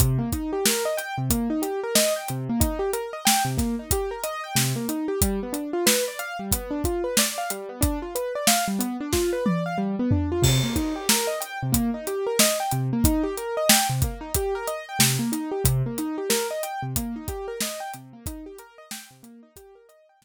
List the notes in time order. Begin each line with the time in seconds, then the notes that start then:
0.00 C3, kick, closed hi-hat
0.18 A#3
0.32 D#4, kick, closed hi-hat
0.53 G4
0.65 A#4, snare
0.85 D#5
0.97 G5, closed hi-hat
1.18 C3
1.30 A#3, kick, closed hi-hat
1.50 D#4
1.62 G4, closed hi-hat
1.84 A#4
1.95 D#5, snare
2.16 G5
2.28 C3, closed hi-hat
2.49 A#3
2.60 D#4, kick, closed hi-hat
2.79 G4
2.93 A#4, closed hi-hat
3.13 D#5
3.25 G5, snare
3.45 C3
3.57 A#3, kick, snare, closed hi-hat
3.79 D#4
3.91 G4, kick, closed hi-hat
4.11 A#4
4.24 D#5, closed hi-hat
4.44 G5
4.55 C3, snare
4.76 A#3
4.89 D#4, closed hi-hat
5.08 G4
5.21 G3, kick, closed hi-hat
5.43 B3
5.53 D4, closed hi-hat
5.73 F4
5.86 B4, snare
6.08 D5
6.19 F5, closed hi-hat
6.39 G3
6.51 B3, kick, closed hi-hat
6.71 D4
6.84 F4, kick, closed hi-hat
7.04 B4
7.17 D5, snare
7.38 F5
7.50 G3, closed hi-hat
7.69 B3
7.81 D4, kick, closed hi-hat
8.02 F4
8.15 B4, closed hi-hat
8.35 D5
8.47 F5, snare
8.68 G3
8.79 B3, closed hi-hat
9.00 D4
9.13 F4, kick, snare
9.33 B4
9.46 D5, high tom
9.66 F5
9.78 G3
9.99 B3
10.11 D4, floor tom
10.32 F4
10.42 C3, kick, crash
10.64 A#3
10.76 D#4, kick, closed hi-hat
10.96 G4
11.09 A#4, snare
11.27 D#5
11.40 G5, closed hi-hat
11.63 C3
11.72 A#3, kick, closed hi-hat
11.94 D#4
12.07 G4, closed hi-hat
12.27 A#4
12.39 D#5, snare
12.60 G5
12.71 C3, closed hi-hat
12.93 A#3
13.04 D#4, kick, closed hi-hat
13.24 G4
13.37 A#4, closed hi-hat
13.57 D#5
13.69 G5, snare
13.90 C3
14.02 A#3, kick, closed hi-hat
14.21 D#4
14.35 G4, kick, closed hi-hat
14.55 A#4
14.68 D#5, closed hi-hat
14.89 G5
14.99 C3, snare
15.19 A#3
15.32 D#4, closed hi-hat
15.51 G4
15.64 C3, kick, closed hi-hat
15.86 A#3
15.98 D#4, closed hi-hat
16.18 G4
16.30 A#4, snare
16.51 D#5
16.63 G5, closed hi-hat
16.82 C3
16.96 A#3, kick, closed hi-hat
17.16 D#4
17.28 G4, kick, closed hi-hat
17.48 A#4
17.60 D#5, snare
17.80 G5
17.94 C3, closed hi-hat
18.13 A#3
18.26 D#4, kick, closed hi-hat
18.46 G4
18.59 A#4, closed hi-hat
18.78 D#5
18.91 G5, snare
19.11 C3
19.23 A#3, closed hi-hat
19.43 D#4
19.56 G4, kick, closed hi-hat
19.75 A#4
19.89 D#5, closed hi-hat
20.09 G5
20.22 C3, snare